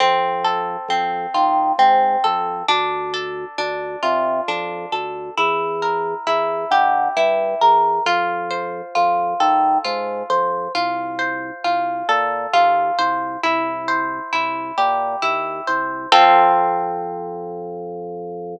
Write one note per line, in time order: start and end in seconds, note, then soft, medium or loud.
0.00 0.77 F2 medium
0.00 0.90 C4 medium
0.44 2.24 A4 medium
0.88 1.26 F2 medium
0.88 1.78 C4 medium
1.34 1.72 D#3 medium
1.34 2.62 F4 medium
1.78 2.16 G#2 medium
1.78 2.64 C4 medium
2.24 2.63 F2 medium
2.24 2.66 A4 medium
2.68 3.45 D2 loud
2.68 3.58 D4 medium
3.14 4.92 A4 medium
3.58 3.96 D2 medium
3.58 4.48 D4 medium
4.03 4.41 C3 medium
4.03 5.30 F4 medium
4.48 4.86 F2 medium
4.48 5.33 D4 medium
4.92 5.30 D2 medium
4.92 5.35 A4 medium
5.37 6.14 E2 loud
5.37 6.26 E4 medium
5.82 7.61 A#4 medium
6.27 6.65 E2 medium
6.27 7.16 E4 medium
6.71 7.09 D3 medium
6.71 7.99 G4 medium
7.17 7.55 G2 medium
7.17 8.02 E4 medium
7.61 7.99 E2 medium
7.61 8.04 A#4 medium
8.06 8.82 F2 medium
8.06 8.95 F4 medium
8.51 10.29 C5 medium
8.95 9.34 F2 medium
8.95 9.84 F4 medium
9.40 9.78 D#3 medium
9.40 10.68 A4 medium
9.85 10.23 G#2 medium
9.85 10.70 F4 medium
10.30 10.68 F2 medium
10.30 10.72 C5 medium
10.75 11.51 C2 medium
10.75 11.64 F4 medium
11.19 12.98 C5 medium
11.64 12.03 C2 medium
11.64 12.53 F4 medium
12.09 12.47 A#2 medium
12.09 13.36 A4 medium
12.53 12.91 D#2 medium
12.53 13.39 F4 medium
12.99 13.37 C2 medium
12.99 13.41 C5 medium
13.43 14.20 C2 medium
13.43 14.32 E4 medium
13.88 15.67 C5 medium
14.33 14.72 C2 medium
14.33 15.22 E4 medium
14.78 15.16 A#2 medium
14.78 16.05 G4 medium
15.22 15.61 D#2 medium
15.22 16.07 E4 medium
15.67 16.06 C2 medium
15.67 16.10 C5 medium
16.12 18.56 F2 loud
16.12 18.56 C4 loud
16.12 18.56 F4 loud
16.12 18.56 A4 loud